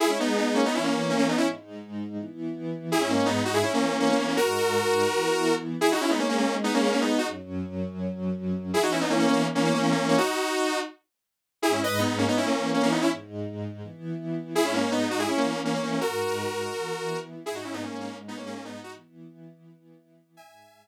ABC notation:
X:1
M:4/4
L:1/16
Q:1/4=165
K:G#m
V:1 name="Lead 2 (sawtooth)"
[EG] [CE] [B,D]2 [B,D]2 [A,C] [B,D] [CE] [A,C]3 [A,C] [A,C] [B,D] [CE] | z16 | [EG] [CE] [A,C]2 [B,D]2 [DF] [EG] [CE] [A,C]3 [A,C] [A,C] [A,C] [A,C] | [FA]14 z2 |
[EG] [DF] [CE] [B,D] [A,C] [A,C] [A,C]2 z [B,D] [A,C] [A,C] [A,C] [B,D]2 [DF] | z16 | [EG] [DF] [CE] [B,D] [A,C] [A,C] [A,C]2 z [A,C] [A,C] [A,C] [A,C] [A,C]2 [A,C] | [DF]8 z8 |
[EG] [CE] [Bd]2 [B,D]2 [A,C] [B,D] [CE] [A,C]3 [A,C] [A,C] [B,D] [CE] | z16 | [EG] [CE] [A,C]2 [B,D]2 [DF] [EG] [CE] [A,C]3 [A,C] [A,C] [A,C] [A,C] | [FA]14 z2 |
[EG] [DF] [CE] [B,D] [A,C] [A,C] [A,C]2 z [B,D] [A,C] [A,C] [A,C] [B,D]2 [DF] | z16 | [eg]16 |]
V:2 name="String Ensemble 1"
[G,DG]8 [E,B,E]8 | [G,,G,D]8 [E,B,E]8 | [G,,G,D]8 [E,B,E]8 | [G,,G,D]8 [E,B,E]8 |
[G,DG]16 | [F,,F,C]16 | [E,B,E]16 | z16 |
[G,,G,D]8 [E,B,E]8 | [G,,G,D]8 [E,B,E]8 | [G,,G,D]8 [E,B,E]8 | [G,,G,D]8 [E,B,E]8 |
[G,,G,D]16 | [E,B,E]16 | [G,,G,D]16 |]